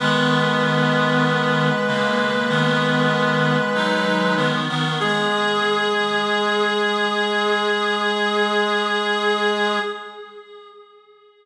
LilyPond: <<
  \new Staff \with { instrumentName = "Clarinet" } { \time 4/4 \key gis \minor \tempo 4 = 48 b'1 | gis'1 | }
  \new Staff \with { instrumentName = "Clarinet" } { \time 4/4 \key gis \minor <dis b>4. <cis ais>8 <dis b>4 <fis dis'>8 <dis b>16 <dis b>16 | gis'1 | }
  \new Staff \with { instrumentName = "Clarinet" } { \clef bass \time 4/4 \key gis \minor gis1 | gis1 | }
>>